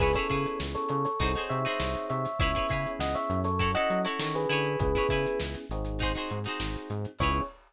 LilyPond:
<<
  \new Staff \with { instrumentName = "Electric Piano 1" } { \time 4/4 \key cis \minor \tempo 4 = 100 <gis' b'>16 <a' cis''>8. r16 <a' cis''>16 <a' cis''>16 <a' cis''>8. <cis'' e''>4 <cis'' e''>8 | <cis'' e''>4 <dis'' fis''>16 <cis'' e''>8 <a' cis''>8 <dis'' fis''>8 <a' cis''>16 <a' cis''>16 <gis' b'>8. | <gis' b'>4 r2. | cis''4 r2. | }
  \new Staff \with { instrumentName = "Acoustic Guitar (steel)" } { \time 4/4 \key cis \minor <e' gis' b' cis''>16 <e' gis' b' cis''>16 <e' gis' b' cis''>4. <dis' fis' gis' bis'>16 <dis' fis' gis' bis'>8 <dis' fis' gis' bis'>4~ <dis' fis' gis' bis'>16 | <e' gis' b' cis''>16 <e' gis' b' cis''>16 <e' gis' b' cis''>4. <e' fis' a' cis''>16 <e' fis' a' cis''>8 <e' fis' a' cis''>8. <e' gis' b' cis''>8~ | <e' gis' b' cis''>16 <e' gis' b' cis''>16 <e' gis' b' cis''>4. <dis' fis' gis' bis'>16 <dis' fis' gis' bis'>8 <dis' fis' gis' bis'>4~ <dis' fis' gis' bis'>16 | <e' gis' b' cis''>4 r2. | }
  \new Staff \with { instrumentName = "Electric Piano 1" } { \time 4/4 \key cis \minor <b cis' e' gis'>2 <bis dis' fis' gis'>2 | <b cis' e' gis'>2 <cis' e' fis' a'>2 | <b cis' e' gis'>4. <bis dis' fis' gis'>2~ <bis dis' fis' gis'>8 | <b cis' e' gis'>4 r2. | }
  \new Staff \with { instrumentName = "Synth Bass 1" } { \clef bass \time 4/4 \key cis \minor cis,8 cis8 cis,8 cis8 bis,,8 bis,8 bis,,8 bis,8 | cis,8 cis8 cis,8 fis,4 fis8 dis8 d8 | cis,8 cis8 cis,8 gis,,4 gis,8 gis,,8 gis,8 | cis,4 r2. | }
  \new DrumStaff \with { instrumentName = "Drums" } \drummode { \time 4/4 <cymc bd>16 <hh bd sn>16 <hh bd>16 <hh sn>16 sn16 hh16 hh16 <hh sn>16 <hh bd>16 hh16 hh16 hh16 sn16 hh16 hh16 <hh sn>16 | <hh bd>16 <hh bd sn>16 <hh bd>16 hh16 sn16 <hh sn>16 hh16 <hh sn>16 <hh bd>16 hh16 hh16 hh16 sn16 hh16 hh16 hh16 | <hh bd>16 <hh bd sn>16 <hh bd>16 hh16 sn16 hh16 hh16 hh16 <hh bd>16 <hh sn>16 hh16 hh16 sn16 hh16 hh16 hh16 | <cymc bd>4 r4 r4 r4 | }
>>